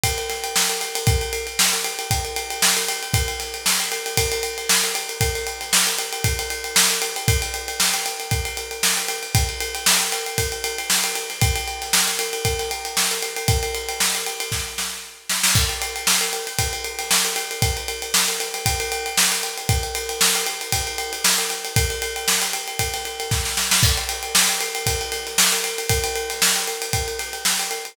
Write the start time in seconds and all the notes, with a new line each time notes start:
0.04 kick, ride
0.18 ride
0.29 snare, ride
0.44 ride
0.56 snare
0.70 ride
0.81 ride
0.95 ride
1.07 kick, ride
1.21 ride
1.33 ride
1.47 ride
1.59 snare
1.73 ride
1.84 ride
1.99 ride
2.11 kick, ride
2.25 ride
2.36 ride
2.50 ride
2.62 snare
2.77 snare, ride
2.88 ride
3.03 ride
3.14 kick, ride
3.28 ride
3.40 snare, ride
3.54 ride
3.66 snare
3.80 ride
3.92 ride
4.06 snare, ride
4.17 kick, ride
4.32 ride
4.43 ride
4.58 ride
4.69 snare
4.84 ride
4.95 ride
5.09 ride
5.21 kick, ride
5.35 snare, ride
5.47 ride
5.61 snare, ride
5.73 snare
5.87 snare, ride
5.98 ride
6.13 ride
6.24 kick, ride
6.39 ride
6.50 ride
6.64 ride
6.76 snare
6.91 ride
7.02 ride
7.16 ride
7.28 kick, ride
7.42 ride
7.54 ride
7.68 ride
7.80 snare
7.94 snare, ride
8.06 ride
8.20 ride
8.31 kick, ride
8.45 ride
8.57 ride
8.71 ride
8.83 snare
8.97 ride
9.09 ride
9.23 ride
9.35 kick, ride
9.49 ride
9.60 ride
9.75 ride
9.86 snare
10.01 ride
10.12 snare, ride
10.26 ride
10.38 kick, ride
10.52 ride
10.64 ride
10.78 ride
10.90 snare
11.04 ride
11.16 ride
11.30 snare, ride
11.41 kick, ride
11.56 ride
11.68 ride
11.82 snare, ride
11.93 snare
12.08 ride
12.19 snare, ride
12.33 ride
12.45 kick, ride
12.59 snare, ride
12.71 ride
12.85 ride
12.97 snare
13.11 ride
13.23 ride
13.37 ride
13.48 kick, ride
13.63 ride
13.75 ride
13.89 ride
14.00 snare
14.15 ride
14.27 ride
14.40 ride
14.52 kick, snare
14.78 snare
15.30 snare
15.43 snare
15.55 kick, crash
15.69 ride
15.82 ride
15.96 ride
16.07 snare
16.21 ride
16.33 ride
16.47 ride
16.59 kick, ride
16.73 ride
16.84 ride
16.99 snare, ride
17.11 snare
17.25 ride
17.36 ride
17.51 ride
17.62 kick, ride
17.77 ride
17.88 ride
18.02 ride
18.14 snare
18.28 ride
18.40 snare, ride
18.54 snare, ride
18.66 kick, ride
18.80 ride
18.92 ride
19.06 ride
19.17 snare
19.32 ride
19.43 ride
19.58 ride
19.69 kick, ride
19.83 ride
19.95 ride
20.09 ride
20.21 snare
20.35 ride
20.47 ride
20.61 ride
20.72 kick, ride
20.87 ride
20.98 ride
21.13 ride
21.24 snare
21.38 ride
21.50 snare, ride
21.65 ride
21.76 kick, ride
21.90 ride
22.02 ride
22.16 ride
22.28 snare
22.42 snare, ride
22.53 ride
22.68 ride
22.79 kick, ride
22.93 snare, ride
23.05 ride
23.20 ride
23.31 kick, snare
23.45 snare
23.57 snare
23.71 snare
23.83 kick, crash
23.98 ride
24.09 ride
24.23 ride
24.35 snare
24.49 ride
24.60 snare, ride
24.75 ride
24.86 kick, ride
25.01 ride
25.12 snare, ride
25.27 snare, ride
25.38 snare
25.52 ride
25.64 snare, ride
25.78 ride
25.89 kick, ride
26.04 ride
26.16 ride
26.30 snare, ride
26.42 snare
26.56 ride
26.68 ride
26.82 ride
26.93 kick, ride
27.08 ride
27.19 snare, ride
27.33 ride
27.45 snare
27.59 ride
27.71 ride
27.85 ride